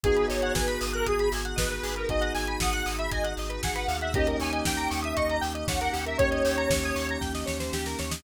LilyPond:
<<
  \new Staff \with { instrumentName = "Lead 1 (square)" } { \time 4/4 \key gis \minor \tempo 4 = 117 gis'8 cis''8 b'8. ais'16 gis'8 r8 b'16 b'8 ais'16 | dis''8 gis''8 fis''8. e''16 dis''8 r8 fis''16 fis''8 e''16 | dis''8 gis''8 g''8. e''16 dis''8 r8 fis''16 fis''8 e''16 | cis''2 r2 | }
  \new Staff \with { instrumentName = "Electric Piano 1" } { \time 4/4 \key gis \minor <b dis' fis' gis'>1 | <b dis' fis' gis'>1 | <ais cis' dis' g'>1 | <ais cis' dis' g'>1 | }
  \new Staff \with { instrumentName = "Lead 1 (square)" } { \time 4/4 \key gis \minor gis'16 b'16 dis''16 fis''16 gis''16 b''16 dis'''16 fis'''16 dis'''16 b''16 gis''16 fis''16 dis''16 b'16 gis'16 b'16 | dis''16 fis''16 gis''16 b''16 dis'''16 fis'''16 dis'''16 b''16 gis''16 fis''16 dis''16 b'16 gis'16 b'16 eis''16 fis''16 | g'16 ais'16 cis''16 dis''16 g''16 ais''16 cis'''16 dis'''16 cis'''16 ais''16 g''16 dis''16 cis''16 ais'16 g'16 ais'16 | cis''16 dis''16 g''16 ais''16 cis'''16 dis'''16 cis'''16 ais''16 g''16 dis''16 cis''16 c''16 g'16 ais'16 cis''16 dis''16 | }
  \new Staff \with { instrumentName = "Synth Bass 2" } { \clef bass \time 4/4 \key gis \minor gis,,8 gis,,8 gis,,8 gis,,8 gis,,8 gis,,8 gis,,8 gis,,8 | gis,,8 gis,,8 gis,,8 gis,,8 gis,,8 gis,,8 gis,,8 dis,8~ | dis,8 dis,8 dis,8 dis,8 dis,8 dis,8 dis,8 dis,8 | dis,8 dis,8 dis,8 dis,8 dis,8 dis,8 dis,8 dis,8 | }
  \new Staff \with { instrumentName = "Pad 5 (bowed)" } { \time 4/4 \key gis \minor <b dis' fis' gis'>1~ | <b dis' fis' gis'>1 | <ais cis' dis' g'>1~ | <ais cis' dis' g'>1 | }
  \new DrumStaff \with { instrumentName = "Drums" } \drummode { \time 4/4 <hh bd>16 hh16 hho16 hh16 <bd sn>16 hh16 hho16 hh16 <hh bd>16 hh16 hho16 hh16 <bd sn>16 hh16 hho16 hh16 | <hh bd>16 hh16 hho16 hh16 <bd sn>16 hh16 hho16 hh16 <hh bd>16 hh16 hho16 hh16 <bd sn>16 hh16 hho16 hh16 | <hh bd>16 hh16 hho16 hh16 <bd sn>16 hh16 hho16 hh16 <hh bd>16 hh16 hho16 hh16 <bd sn>16 hh16 hho16 hh16 | <hh bd>16 hh16 hho16 hh16 <bd sn>16 hh16 hho16 hh16 <bd sn>16 sn16 sn16 sn16 sn16 sn16 sn16 sn16 | }
>>